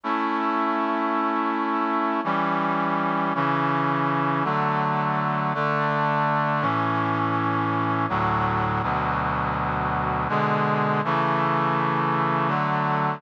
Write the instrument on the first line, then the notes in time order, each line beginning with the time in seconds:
brass section
0.04 A3 C#4 E4
2.24 E3 G3 C#4
3.35 C#3 E3 C#4
4.44 D3 F#3 A3
5.54 D3 A3 D4
6.61 A2 E3 C#4
8.09 D2 A2 F#3
8.83 D2 B2 F#3
10.29 B2 D3 G#3
11.04 C#3 E3 A3
12.48 D3 F#3 A3